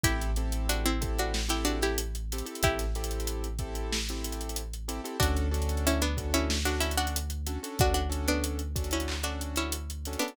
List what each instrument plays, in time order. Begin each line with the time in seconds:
0.03 synth bass 2 A1, acoustic grand piano C4 E4 G4 A4, pizzicato strings E4 G4, kick, closed hi-hat
0.22 closed hi-hat
0.36 acoustic grand piano C4 E4 G4 A4, closed hi-hat
0.52 closed hi-hat
0.69 pizzicato strings D4 F#4, closed hi-hat
0.85 pizzicato strings C4 E4, closed hi-hat
1.01 acoustic grand piano C4 E4 G4 A4, kick, closed hi-hat
1.19 pizzicato strings D4 F#4, closed hi-hat
1.34 snare
1.49 acoustic grand piano C4 E4 G4 A4, pizzicato strings E4 G4, closed hi-hat
1.65 pizzicato strings D4 F#4, closed hi-hat
1.81 pizzicato strings E4 G4, snare, closed hi-hat
1.98 closed hi-hat
2.15 closed hi-hat
2.32 acoustic grand piano C4 E4 G4 A4, closed hi-hat
2.38 closed hi-hat
2.46 acoustic grand piano C4 E4 G4 A4, closed hi-hat
2.55 closed hi-hat
2.63 synth bass 2 A1, pizzicato strings E4 G4, kick, closed hi-hat
2.79 snare, closed hi-hat
2.95 acoustic grand piano C4 E4 G4 A4, snare, closed hi-hat
3.04 closed hi-hat
3.11 closed hi-hat
3.20 closed hi-hat
3.27 closed hi-hat
3.44 closed hi-hat
3.59 acoustic grand piano C4 E4 G4 A4, kick, closed hi-hat
3.75 closed hi-hat
3.92 snare
4.09 acoustic grand piano C4 E4 G4 A4, closed hi-hat
4.24 closed hi-hat
4.32 closed hi-hat
4.41 closed hi-hat
4.49 closed hi-hat
4.56 closed hi-hat
4.74 closed hi-hat
4.88 acoustic grand piano C4 E4 G4 A4, closed hi-hat
5.04 acoustic grand piano C4 E4 G4 A4, closed hi-hat
5.20 synth bass 2 D2, acoustic grand piano C#4 D4 F#4 A4, pizzicato strings D4 F#4, kick, closed hi-hat
5.37 closed hi-hat
5.51 acoustic grand piano C#4 D4 F#4 A4, closed hi-hat
5.62 closed hi-hat
5.69 closed hi-hat
5.77 closed hi-hat
5.87 pizzicato strings C#4 E4, closed hi-hat
6.02 pizzicato strings B3 D4, closed hi-hat
6.17 acoustic grand piano C#4 D4 F#4 A4, kick, closed hi-hat
6.34 pizzicato strings C#4 E4, closed hi-hat
6.50 snare
6.65 acoustic grand piano C#4 D4 F#4 A4, pizzicato strings D4 F#4, closed hi-hat
6.80 pizzicato strings C#4 E4, closed hi-hat
6.91 closed hi-hat
6.97 pizzicato strings D4 F#4, closed hi-hat
7.07 closed hi-hat
7.16 closed hi-hat
7.30 closed hi-hat
7.47 acoustic grand piano C#4 D4 F#4 A4, closed hi-hat
7.63 acoustic grand piano C#4 D4 F#4 A4, closed hi-hat
7.79 synth bass 2 D2, pizzicato strings D4 F#4, kick, closed hi-hat
7.94 pizzicato strings D4 F#4, closed hi-hat
8.09 acoustic grand piano C#4 D4 F#4 A4, closed hi-hat
8.28 pizzicato strings B3 D4, closed hi-hat
8.44 closed hi-hat
8.59 closed hi-hat
8.76 acoustic grand piano C#4 D4 F#4 A4, kick, closed hi-hat
8.84 closed hi-hat
8.91 pizzicato strings C#4 E4, closed hi-hat
9.00 closed hi-hat
9.08 clap
9.23 acoustic grand piano C#4 D4 F#4 A4, pizzicato strings D4 F#4, closed hi-hat
9.41 closed hi-hat
9.56 pizzicato strings C#4 E4, closed hi-hat
9.72 closed hi-hat
9.90 closed hi-hat
10.05 acoustic grand piano C#4 D4 F#4 A4, closed hi-hat
10.13 closed hi-hat
10.19 pizzicato strings B3 D4, acoustic grand piano C#4 D4 F#4 A4, closed hi-hat
10.28 closed hi-hat